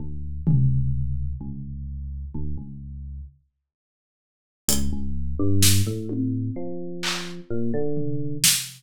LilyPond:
<<
  \new Staff \with { instrumentName = "Electric Piano 1" } { \clef bass \time 5/4 \tempo 4 = 64 d,8 cis,4 cis,4 d,16 cis,8. r4. | cis,16 cis,8 g,8 a,8. f4 ais,16 d8. r4 | }
  \new DrumStaff \with { instrumentName = "Drums" } \drummode { \time 5/4 r8 tomfh8 r4 r4 r4 r4 | hh4 sn8 tommh8 r8 hc8 r8 tomfh8 sn4 | }
>>